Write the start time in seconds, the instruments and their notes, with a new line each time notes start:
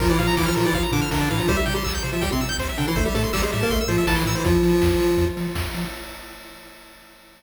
0.00 synth bass 1 A#1, lead 1 (square) F3 F4 A#4, kick, crash
0.09 lead 1 (square) E3 E4 D5
0.18 synth bass 1 A#2, lead 1 (square) F3 F4 F5, open hi-hat
0.27 lead 1 (square) A#5
0.37 synth bass 1 A#1, lead 1 (square) E3 E4 D6, kick, snare
0.46 lead 1 (square) F3 F4 F6
0.55 synth bass 1 A#2, lead 1 (square) F3 F4 A#4, open hi-hat
0.65 lead 1 (square) E3 E4 D5
0.73 synth bass 1 A#1, lead 1 (square) F3 F4 F5, kick, closed hi-hat
0.83 lead 1 (square) A#5
0.92 synth bass 1 A#2, lead 1 (square) D3 D4 D6, open hi-hat
1.02 lead 1 (square) F6
1.11 synth bass 1 A#1, lead 1 (square) D3 D4 A#4, kick, snare
1.21 lead 1 (square) D5
1.30 synth bass 1 A2, lead 1 (square) E3 E4 F5, open hi-hat
1.38 lead 1 (square) F3 F4 A#5
1.48 synth bass 1 C2, lead 1 (square) G3 G4 C5, kick, closed hi-hat
1.56 lead 1 (square) G3 G4 E5
1.66 synth bass 1 C3, lead 1 (square) G5, open hi-hat
1.74 lead 1 (square) G3 G4 C6
1.84 synth bass 1 C2, lead 1 (square) E6, kick, clap
1.95 lead 1 (square) G6
2.03 synth bass 1 C3, lead 1 (square) C5, open hi-hat
2.12 lead 1 (square) F3 F4 E5
2.21 synth bass 1 C2, lead 1 (square) G3 G4 G5, kick, closed hi-hat
2.32 lead 1 (square) C3 C4 C6
2.41 synth bass 1 C3, lead 1 (square) E6, open hi-hat
2.49 lead 1 (square) G6
2.58 synth bass 1 C2, lead 1 (square) C5, kick, clap
2.69 lead 1 (square) E5
2.77 synth bass 1 C3, lead 1 (square) D3 D4 G5, open hi-hat
2.88 lead 1 (square) E3 E4 C6
2.96 synth bass 1 A1, lead 1 (square) A3 A4 C5, kick, closed hi-hat
3.05 lead 1 (square) G3 G4 E5
3.14 synth bass 1 A2, lead 1 (square) A3 A4 A5, open hi-hat
3.24 lead 1 (square) C6
3.33 synth bass 1 A1, lead 1 (square) G3 G4 E6, kick, clap
3.42 lead 1 (square) G#3 G#4 C5
3.52 synth bass 1 A2, lead 1 (square) G3 G4 E5, open hi-hat
3.61 lead 1 (square) A#3 A#4 A5
3.70 synth bass 1 A1, lead 1 (square) A3 A4 C6, kick, closed hi-hat
3.81 lead 1 (square) E6
3.88 synth bass 1 A2, lead 1 (square) F3 F4 C5, open hi-hat
3.98 lead 1 (square) E5
4.07 synth bass 1 A1, lead 1 (square) E3 E4 A5, kick, snare
4.16 lead 1 (square) C6
4.25 synth bass 1 A2, lead 1 (square) E3 E4 E6, open hi-hat
4.35 lead 1 (square) E3 E4 C5
4.44 synth bass 1 F2, lead 1 (square) F3 F4, kick, closed hi-hat
4.63 synth bass 1 F3, open hi-hat
4.81 synth bass 1 F2, kick, snare
5.00 synth bass 1 F3, open hi-hat
5.17 synth bass 1 F2, kick, closed hi-hat
5.37 synth bass 1 F3, open hi-hat
5.55 synth bass 1 F2, kick, snare
5.74 synth bass 1 F3, open hi-hat